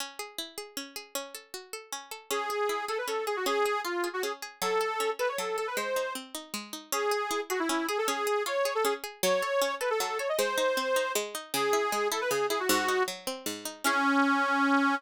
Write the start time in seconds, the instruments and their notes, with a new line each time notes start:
0.00 pizzicato strings C#4
0.19 pizzicato strings G#4
0.38 pizzicato strings E4
0.58 pizzicato strings G#4
0.77 pizzicato strings C#4
0.96 pizzicato strings G#4
1.15 pizzicato strings C#4
1.35 pizzicato strings A4
1.54 pizzicato strings F#4
1.73 pizzicato strings A4
1.92 pizzicato strings C#4
2.11 pizzicato strings A4
2.31 pizzicato strings C#4, accordion G#4
2.50 pizzicato strings G#4
2.69 pizzicato strings E4
2.88 pizzicato strings G#4, accordion A4
2.98 accordion B4
3.08 pizzicato strings C#4, accordion A4
3.27 accordion G#4, pizzicato strings G#4
3.36 accordion F#4
3.46 pizzicato strings C#4, accordion G#4
3.66 pizzicato strings G#4
3.84 accordion F4, pizzicato strings F4
4.04 pizzicato strings G#4
4.13 accordion F#4
4.23 pizzicato strings C#4, accordion G#4
4.42 pizzicato strings G#4
4.62 pizzicato strings F#3, accordion A4
4.81 pizzicato strings A4
5.00 pizzicato strings C#4
5.19 pizzicato strings A4, accordion B4
5.29 accordion C#5
5.38 pizzicato strings F#3, accordion A4
5.58 accordion A4, pizzicato strings A4
5.67 accordion B4
5.77 pizzicato strings G#3, accordion C5
5.96 pizzicato strings D#4
6.15 pizzicato strings C4
6.35 pizzicato strings D#4
6.54 pizzicato strings G#3
6.73 pizzicato strings D#4
6.92 pizzicato strings C#4, accordion G#4
7.11 pizzicato strings G#4
7.31 pizzicato strings E4
7.50 accordion F#4, pizzicato strings G#4
7.60 accordion E4
7.69 pizzicato strings C#4, accordion E4
7.89 accordion G#4, pizzicato strings G#4
7.98 accordion A4
8.08 pizzicato strings C#4, accordion G#4
8.27 pizzicato strings G#4
8.46 pizzicato strings F4, accordion C#5
8.65 pizzicato strings G#4
8.75 accordion A4
8.85 pizzicato strings C#4, accordion G#4
9.04 pizzicato strings G#4
9.23 pizzicato strings F#3, accordion C#5
9.42 pizzicato strings A4
9.62 pizzicato strings C#4
9.81 pizzicato strings A4, accordion B4
9.90 accordion A4
10.00 pizzicato strings F#3, accordion A4
10.19 pizzicato strings A4, accordion C#5
10.29 accordion D#5
10.38 pizzicato strings G#3, accordion C5
10.58 pizzicato strings D#4
10.77 pizzicato strings C4
10.96 pizzicato strings D#4
11.15 pizzicato strings G#3
11.35 pizzicato strings D#4
11.54 pizzicato strings C#3, accordion G#4
11.73 pizzicato strings E4
11.92 pizzicato strings G#3
12.11 pizzicato strings E4, accordion A4
12.21 accordion B4
12.31 pizzicato strings C#3, accordion G#4
12.50 pizzicato strings E4, accordion G#4
12.60 accordion F#4
12.69 pizzicato strings G#2, accordion F#4
12.88 pizzicato strings D#4
13.08 pizzicato strings F#3
13.27 pizzicato strings C4
13.46 pizzicato strings G#2
13.65 pizzicato strings D#4
13.84 pizzicato strings C#4 E4 G#4, accordion C#4